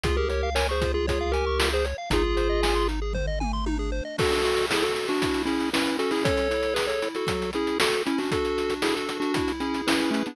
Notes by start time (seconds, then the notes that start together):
0.04 C#2 F4 G#4, kick, closed hi-hat
0.17 G4 G#4 A#4
0.29 G4 A#4 C#5, closed hi-hat
0.43 F5
0.55 A#4 C#5 G#5, snare
0.69 G#4 C5 C#6
0.82 F4, kick, closed hi-hat
0.94 F4 G#4
1.07 F4 G#4 C#5, kick, closed hi-hat
1.21 F5
1.32 G4 A#4 G#5, closed hi-hat
1.47 C#6
1.59 F4, snare
1.72 G#4 C5
1.85 C#5, closed hi-hat
1.98 F5
2.10 G#1 D#4 F4 G#4, kick, closed hi-hat
2.24 G#4
2.37 C5, closed hi-hat
2.50 D#5
2.63 G#5, snare
2.75 C6
2.88 D#4, closed hi-hat
3.02 G#4
3.13 C5, kick, floor tom
3.27 D#5
3.40 G#5, mid tom
3.53 C6
3.66 D#4, high tom
3.79 G#4
3.92 C5
4.05 D#5
4.18 D4 F#4 A4, kick, crash
4.32 closed hi-hat
4.44 F#4, closed hi-hat
4.57 closed hi-hat
4.70 E4 G#4 A4, snare
4.82 F#4 A4, closed hi-hat
4.95 F#4, closed hi-hat
5.08 D4 F#4, closed hi-hat
5.21 E4, kick, closed hi-hat
5.34 closed hi-hat
5.45 C#4 E4 G#4, closed hi-hat
5.60 closed hi-hat
5.73 C#4 E4 B4, snare
5.86 closed hi-hat
5.99 C#4 F#4 A4, closed hi-hat
6.11 E4 G#4, open hi-hat
6.24 A4 C#5, kick, closed hi-hat
6.37 closed hi-hat
6.50 E4, closed hi-hat
6.63 closed hi-hat
6.74 G#4 B4, snare
6.87 A4 C#5, closed hi-hat
7.02 E4, closed hi-hat
7.15 F#4 A4, closed hi-hat
7.27 F#3, kick, closed hi-hat
7.42 closed hi-hat
7.53 C#4 E4 G#4, closed hi-hat
7.67 closed hi-hat
7.80 F#4 A4, snare
7.94 closed hi-hat
8.06 C#4 E4, closed hi-hat
8.18 D4 F#4, open hi-hat
8.31 D4 F#4 A4, kick, closed hi-hat
8.45 closed hi-hat
8.58 F#4, closed hi-hat
8.70 closed hi-hat
8.82 E4 G#4 A4, snare
8.95 F#4 A4, closed hi-hat
9.09 D4, closed hi-hat
9.20 D4 F#4, closed hi-hat
9.34 E4, kick, closed hi-hat
9.48 closed hi-hat
9.60 C#4 E4 G#4, closed hi-hat
9.74 closed hi-hat
9.87 C#4 E4 B4, snare
10.00 closed hi-hat
10.11 A3 C#4 E4, closed hi-hat
10.26 B3 D4, closed hi-hat